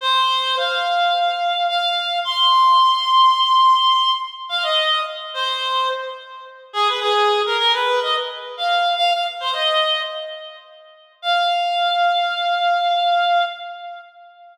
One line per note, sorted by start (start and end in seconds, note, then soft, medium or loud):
0.01 0.56 C5 loud
0.57 1.66 F5 medium
1.68 2.18 F5 loud
2.25 4.11 C6 loud
4.49 4.64 F5 loud
4.63 5.01 D#5 loud
5.34 5.89 C5 loud
6.73 6.88 G#4 loud
6.88 7.00 B4 medium
7.01 7.41 G#4 loud
7.46 7.57 A#4 loud
7.58 7.72 A#4 loud
7.73 8.00 B4 loud
8.02 8.14 D#5 loud
8.57 8.93 F5 medium
8.96 9.11 F5 loud
9.12 9.24 F5 medium
9.40 9.52 C5 medium
9.53 10.00 D#5 loud
11.22 13.43 F5 loud